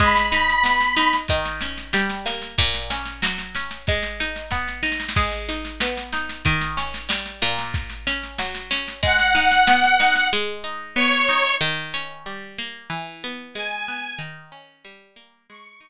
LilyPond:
<<
  \new Staff \with { instrumentName = "Accordion" } { \time 2/4 \key gis \minor \tempo 4 = 93 b''2 | r2 | r2 | r2 |
r2 | r2 | r2 | fis''2 |
r4 cis''4 | r2 | r4 gis''4 | r2 |
cis'''2 | }
  \new Staff \with { instrumentName = "Pizzicato Strings" } { \time 2/4 \key gis \minor gis8 dis'8 b8 dis'8 | dis8 cis'8 g8 ais8 | ais,8 cis'8 fis8 cis'8 | gis8 dis'8 b8 dis'8 |
gis8 dis'8 b8 dis'8 | dis8 cis'8 g8 ais,8~ | ais,8 cis'8 fis8 cis'8 | gis8 dis'8 b8 dis'8 |
gis8 dis'8 b8 dis'8 | dis8 cis'8 g8 ais8 | e8 b8 gis8 b8 | dis8 cis'8 g8 ais8 |
gis8 dis'8 r4 | }
  \new DrumStaff \with { instrumentName = "Drums" } \drummode { \time 2/4 <bd sn>16 sn16 sn16 sn16 sn16 sn16 sn16 sn16 | <bd sn>16 sn16 sn16 sn16 sn16 sn16 sn16 sn16 | <bd sn>16 sn16 sn16 sn16 sn16 sn16 sn16 sn16 | <bd sn>16 sn16 sn16 sn16 <bd sn>16 sn16 sn32 sn32 sn32 sn32 |
<cymc bd sn>16 sn16 sn16 sn16 sn16 sn16 sn16 sn16 | <bd sn>16 sn16 sn16 sn16 sn16 sn16 sn16 sn16 | <bd sn>16 sn16 sn16 sn16 sn16 sn16 sn16 sn16 | <bd sn>16 sn16 sn16 sn16 sn16 sn16 sn16 sn16 |
r4 r4 | r4 r4 | r4 r4 | r4 r4 |
r4 r4 | }
>>